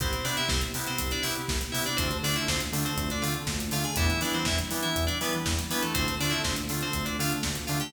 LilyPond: <<
  \new Staff \with { instrumentName = "Electric Piano 2" } { \time 4/4 \key c \major \tempo 4 = 121 <c' c''>8 <d' d''>16 <e' e''>16 <c' c''>16 r8 <c' c''>8 <d' d''>16 <e' e''>16 r8. <e' e''>16 <d' d''>16 | <c' c''>8 <d' d''>16 <e' e''>16 <c' c''>16 r8 <c' c''>8 <d' d''>16 <f' f''>16 r8. <f' f''>16 <gis' gis''>16 | <e' e''>8 <d' d''>16 <c' c''>16 <e' e''>16 r8 <e' e''>8 <d' d''>16 <b b'>16 r8. <b b'>16 <a a'>16 | <c' c''>8 <d' d''>16 <e' e''>16 <c' c''>16 r8 <c' c''>8 <d' d''>16 <f' f''>16 r8. <f' f''>16 <g' g''>16 | }
  \new Staff \with { instrumentName = "Electric Piano 2" } { \time 4/4 \key c \major <b c' e' g'>8 <b c' e' g'>4 <b c' e' g'>4 <b c' e' g'>4 <b c' e' g'>8 | <a c' d' f'>8 <a c' d' f'>4 <a c' d' f'>4 <a c' d' f'>4 <a c' d' f'>8 | <g b d' e'>8 <g b d' e'>4 <g b d' e'>4 <g b d' e'>4 <g b d' e'>8 | <a c' d' f'>8 <a c' d' f'>4 <a c' d' f'>4 <a c' d' f'>4 <a c' d' f'>8 | }
  \new Staff \with { instrumentName = "Synth Bass 1" } { \clef bass \time 4/4 \key c \major c,8 c8 c,8 c8 c,8 c8 c,8 c8 | d,8 d8 d,8 d8 d,8 d8 d,8 d8 | e,8 e8 e,8 e8 e,8 e8 e,8 e8 | d,8 d8 d,8 d8 d,8 d8 d,8 d8 | }
  \new Staff \with { instrumentName = "Pad 2 (warm)" } { \time 4/4 \key c \major <b c' e' g'>1 | <a c' d' f'>1 | <g b d' e'>1 | <a c' d' f'>1 | }
  \new DrumStaff \with { instrumentName = "Drums" } \drummode { \time 4/4 <hh bd>16 hh16 hho16 hh16 <bd sn>16 hh16 hho16 hh16 <hh bd>16 hh16 hho16 hh16 <bd sn>16 hh16 hho16 hh16 | <hh bd>16 hh16 hho16 hh16 <bd sn>16 hh16 hho16 hh16 <hh bd>16 hh16 hho16 hh16 <bd sn>16 hh16 hho16 hh16 | <hh bd>16 hh16 hho16 hh16 <bd sn>16 hh16 hho16 hh16 <hh bd>16 hh16 hho16 hh16 <bd sn>16 hh16 hho16 hh16 | <hh bd>16 hh16 hho16 hh16 <bd sn>16 hh16 hho16 hh16 <hh bd>16 hh16 hho16 hh16 <bd sn>16 hh16 hho16 hh16 | }
>>